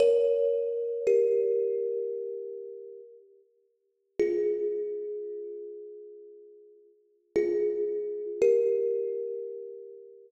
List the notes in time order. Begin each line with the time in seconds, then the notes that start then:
0.00 A#4 C#5
1.07 G4 A#4
4.20 F4 G#4
7.36 F4 G#4
8.42 G4 A#4